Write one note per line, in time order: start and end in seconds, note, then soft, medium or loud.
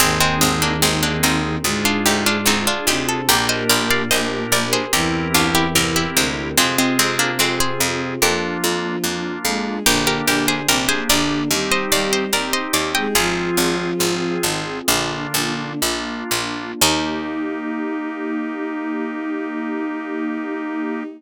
0.00 0.35 G#1 medium
0.00 1.57 D#2 medium
0.00 1.57 D#3 medium
0.00 0.19 G#3 loud
0.00 0.19 C4 loud
0.00 0.74 C4 loud
0.00 1.64 C4 loud
0.00 0.74 D#4 loud
0.00 1.64 D#4 loud
0.00 0.74 G#4 loud
0.00 1.64 G#4 medium
0.21 0.40 G#3 medium
0.21 0.40 C4 loud
0.41 0.77 G#1 medium
0.41 0.61 G#3 medium
0.41 0.61 C4 medium
0.62 0.82 A#3 medium
0.62 0.82 D4 medium
0.82 1.17 G#1 medium
0.82 1.02 G#3 medium
0.82 1.56 C4 medium
0.82 1.02 C4 medium
0.82 1.56 D#4 loud
0.82 1.56 G#4 loud
1.03 1.22 A#3 medium
1.03 1.22 D4 medium
1.23 1.58 G#1 medium
1.23 1.73 C4 medium
1.23 1.73 D#4 medium
1.64 1.99 D2 medium
1.64 2.65 G#2 medium
1.64 2.65 G#3 medium
1.64 2.39 D4 loud
1.64 3.28 D4 loud
1.64 2.39 F4 loud
1.64 3.28 F4 loud
1.64 2.39 G#4 loud
1.64 3.28 G#4 loud
1.85 2.05 D4 medium
1.85 2.05 F4 loud
2.06 2.41 D2 medium
2.06 2.25 D#4 medium
2.06 2.25 G4 medium
2.26 2.46 D4 medium
2.26 2.46 F4 medium
2.46 2.80 D2 medium
2.46 2.66 C4 medium
2.46 3.21 D4 medium
2.46 2.66 D#4 medium
2.46 3.21 F4 medium
2.46 3.21 G#4 medium
2.67 2.87 D4 medium
2.67 2.87 F4 medium
2.87 3.22 D2 medium
2.87 3.28 C3 medium
2.87 3.28 C4 medium
2.87 3.07 D#4 medium
2.87 3.07 G4 medium
3.09 3.28 A4 medium
3.28 3.64 A#1 loud
3.28 4.76 A#2 medium
3.28 4.76 A#3 medium
3.28 4.91 D4 loud
3.28 4.03 D4 loud
3.28 4.91 G4 loud
3.28 4.03 G4 loud
3.28 3.48 G4 loud
3.28 4.91 A#4 loud
3.28 4.03 A#4 loud
3.28 3.48 A#4 loud
3.49 3.68 C5 medium
3.49 3.68 D#5 loud
3.70 4.05 A#1 medium
3.70 3.89 A#4 medium
3.70 3.89 D5 loud
3.90 4.10 D5 medium
3.90 4.10 F5 loud
4.11 4.47 A#1 medium
4.11 4.85 D4 loud
4.11 4.85 G4 medium
4.11 4.85 A#4 medium
4.11 4.45 C5 medium
4.11 4.45 D#5 medium
4.52 4.87 A#1 medium
4.52 4.72 A#4 medium
4.52 4.72 D5 loud
4.73 4.92 G#4 medium
4.73 4.92 C5 loud
4.92 5.28 C2 medium
4.92 6.05 E2 medium
4.92 6.05 E3 medium
4.92 6.55 C4 loud
4.92 5.67 C4 loud
4.92 6.55 E4 loud
4.92 5.67 E4 loud
4.92 6.55 G4 medium
4.92 5.67 G4 loud
4.92 5.33 G4 medium
4.92 6.55 A#4 loud
4.92 5.67 A#4 loud
4.92 5.33 A#4 medium
5.34 5.69 C2 medium
5.34 5.54 D4 medium
5.34 5.54 F4 loud
5.55 5.74 E4 medium
5.55 5.74 G4 loud
5.75 6.10 C2 medium
5.75 6.49 C4 medium
5.75 6.49 E4 medium
5.75 6.49 G4 medium
5.75 5.95 G4 medium
5.75 6.49 A#4 medium
5.75 5.95 A#4 medium
5.96 6.15 E4 medium
5.96 6.15 G4 medium
6.16 6.52 C2 medium
6.16 6.54 D2 medium
6.16 6.54 D3 medium
6.16 6.55 G#3 medium
6.16 6.55 C4 loud
6.57 6.93 F2 medium
6.57 8.17 C3 medium
6.57 6.77 G#3 medium
6.57 7.31 C4 loud
6.57 6.77 C4 loud
6.57 8.20 C4 medium
6.57 8.17 C4 medium
6.57 7.31 F4 loud
6.57 8.20 F4 loud
6.57 7.31 G#4 loud
6.57 8.20 G#4 loud
6.78 6.98 G#3 medium
6.78 6.98 C4 medium
6.99 7.34 F2 medium
6.99 7.18 G#3 medium
6.99 7.18 C4 loud
7.19 7.39 A#3 medium
7.19 7.39 D4 loud
7.39 7.74 F2 medium
7.39 7.59 G#3 medium
7.39 7.59 C4 medium
7.39 8.14 C4 loud
7.39 8.14 F4 medium
7.39 8.14 G#4 loud
7.60 7.80 G#4 medium
7.60 7.80 C5 loud
7.80 8.15 F2 medium
8.22 8.57 F2 loud
8.22 9.29 F3 medium
8.22 8.96 A#3 loud
8.22 9.85 A#3 medium
8.22 8.96 D4 loud
8.22 9.85 D4 medium
8.22 8.96 F4 loud
8.22 9.85 F4 loud
8.22 9.29 F4 medium
8.22 9.24 G4 medium
8.22 9.24 A#4 medium
8.64 8.99 F2 medium
9.04 9.39 F2 medium
9.04 9.78 A#3 loud
9.04 9.78 D4 medium
9.04 9.78 F4 medium
9.45 9.80 F2 medium
9.45 9.81 G#3 medium
9.45 9.81 G#4 medium
9.86 10.21 A#1 loud
9.86 10.22 D3 medium
9.86 11.48 A#3 loud
9.86 10.60 A#3 loud
9.86 11.48 D4 medium
9.86 10.60 D4 loud
9.86 10.22 D4 medium
9.86 11.48 G4 medium
9.86 10.06 G4 loud
9.86 10.60 G4 loud
9.86 10.06 A#4 loud
10.07 10.27 G4 medium
10.07 10.27 A#4 loud
10.26 10.62 A#1 medium
10.26 10.66 D3 medium
10.26 10.66 D4 medium
10.26 10.47 G4 medium
10.26 10.47 A#4 loud
10.48 10.68 G#4 medium
10.48 10.68 C5 loud
10.67 11.03 A#1 medium
10.67 10.87 C3 medium
10.67 11.43 A#3 loud
10.67 10.87 C4 medium
10.67 11.43 D4 loud
10.67 10.88 G4 medium
10.67 11.43 G4 medium
10.67 10.88 A#4 medium
10.89 11.08 G#4 loud
10.89 11.08 C5 loud
11.09 11.44 A#1 medium
11.09 11.48 D3 medium
11.09 11.48 D4 medium
11.09 11.59 A#4 medium
11.09 11.59 D5 loud
11.51 11.85 D#2 medium
11.51 11.89 G3 medium
11.51 12.24 C4 loud
11.51 13.14 C4 medium
11.51 12.24 D#4 loud
11.51 13.14 D#4 medium
11.51 11.89 G4 medium
11.51 12.24 G4 loud
11.51 13.14 G4 medium
11.72 11.91 C5 medium
11.72 11.91 D#5 loud
11.90 12.27 D#2 medium
11.90 12.30 G3 medium
11.90 12.30 G4 medium
11.90 12.11 D5 medium
11.90 12.11 F5 medium
12.13 12.32 C5 medium
12.13 12.32 D#5 medium
12.33 12.68 D#2 medium
12.33 13.07 C4 loud
12.33 13.07 D#4 loud
12.33 13.07 G4 loud
12.33 12.53 A#4 medium
12.33 12.53 D5 medium
12.53 12.73 C5 medium
12.53 12.73 D#5 medium
12.73 13.08 D#2 medium
12.73 12.93 D5 medium
12.73 12.93 F5 medium
12.95 13.16 G#3 medium
12.95 13.16 G#4 medium
12.95 13.14 D#5 medium
12.95 13.14 G5 medium
13.14 13.50 G#1 medium
13.14 14.38 F3 medium
13.14 14.86 C4 medium
13.14 13.91 C4 loud
13.14 14.86 F4 medium
13.14 13.91 F4 loud
13.14 15.13 F4 loud
13.14 14.38 F4 medium
13.14 14.86 G#4 loud
13.14 13.91 G#4 loud
13.14 15.13 G#4 loud
13.57 13.93 G#1 medium
13.99 14.37 G#1 medium
13.99 14.79 C4 loud
13.99 14.79 F4 medium
13.99 14.79 G#4 loud
14.42 14.81 G#1 medium
14.42 14.63 D#3 medium
14.42 14.63 D#4 medium
14.88 15.27 A#1 loud
14.88 15.77 D3 medium
14.88 16.80 A#3 loud
14.88 15.73 A#3 loud
14.88 16.80 D4 medium
14.88 15.73 D4 loud
14.88 15.77 D4 medium
14.88 16.80 F4 loud
14.88 15.73 F4 loud
15.34 15.74 A#1 medium
15.82 16.24 A#1 medium
15.82 16.72 A#3 loud
15.82 16.72 D4 loud
15.82 16.72 F4 loud
16.31 16.74 A#1 medium
16.81 21.03 D#2 loud
16.81 21.03 A#3 loud
16.81 21.04 A#3 loud
16.81 21.03 D#4 loud
16.81 21.03 D#4 medium
16.81 21.03 D#4 loud
16.81 21.04 D#4 medium
16.81 21.03 G4 medium
16.81 21.04 G4 loud